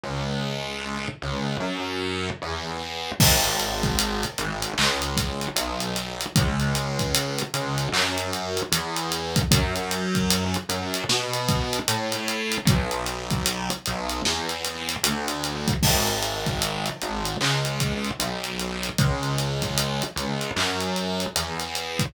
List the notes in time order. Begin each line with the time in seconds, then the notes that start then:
0.03 C#2
1.22 C#2
1.60 F#2
2.42 E2
3.20 G#1, kick, crash
3.44 closed hi-hat
3.60 closed hi-hat
3.83 kick, closed hi-hat
3.99 closed hi-hat
4.23 closed hi-hat
4.38 G#1, closed hi-hat
4.62 closed hi-hat
4.78 C#2, clap
5.02 closed hi-hat
5.17 kick, closed hi-hat
5.41 closed hi-hat
5.56 B1, closed hi-hat
5.80 closed hi-hat
5.96 closed hi-hat
6.21 closed hi-hat
6.36 C#2, kick, closed hi-hat
6.60 closed hi-hat
6.75 snare, closed hi-hat
6.99 kick, snare, closed hi-hat
7.14 closed hi-hat
7.38 closed hi-hat
7.54 C#2, closed hi-hat
7.78 closed hi-hat
7.92 F#2, clap
8.18 closed hi-hat
8.33 closed hi-hat
8.57 closed hi-hat
8.72 E2, closed hi-hat
8.96 closed hi-hat
9.12 closed hi-hat
9.36 kick, closed hi-hat
9.51 F#2, kick, closed hi-hat
9.75 closed hi-hat
9.91 closed hi-hat
10.15 kick, closed hi-hat
10.30 closed hi-hat
10.54 closed hi-hat
10.69 F#2, closed hi-hat
10.94 closed hi-hat
11.09 B2, snare
11.33 closed hi-hat
11.48 kick, closed hi-hat
11.73 closed hi-hat
11.88 A2, closed hi-hat
12.12 closed hi-hat
12.28 closed hi-hat
12.52 closed hi-hat
12.65 B1, kick, closed hi-hat
12.91 closed hi-hat
13.06 closed hi-hat
13.30 kick, closed hi-hat
13.46 closed hi-hat
13.70 closed hi-hat
13.86 B1, closed hi-hat
14.09 closed hi-hat
14.25 E2, snare
14.49 closed hi-hat
14.64 closed hi-hat
14.89 snare, closed hi-hat
15.03 D2, closed hi-hat
15.28 closed hi-hat
15.44 closed hi-hat
15.68 kick, closed hi-hat
15.83 G#1, kick, crash
16.07 closed hi-hat
16.22 closed hi-hat
16.46 kick, closed hi-hat
16.62 closed hi-hat
16.86 closed hi-hat
17.01 G#1, closed hi-hat
17.25 closed hi-hat
17.41 C#2, clap
17.65 closed hi-hat
17.80 kick, closed hi-hat
18.04 closed hi-hat
18.19 B1, closed hi-hat
18.44 closed hi-hat
18.59 closed hi-hat
18.83 closed hi-hat
18.98 C#2, kick, closed hi-hat
19.23 closed hi-hat
19.38 snare, closed hi-hat
19.62 kick, snare, closed hi-hat
19.77 closed hi-hat
20.02 closed hi-hat
20.16 C#2, closed hi-hat
20.41 closed hi-hat
20.56 F#2, clap
20.80 closed hi-hat
20.96 closed hi-hat
21.20 closed hi-hat
21.36 E2, closed hi-hat
21.60 closed hi-hat
21.75 closed hi-hat
21.99 kick, closed hi-hat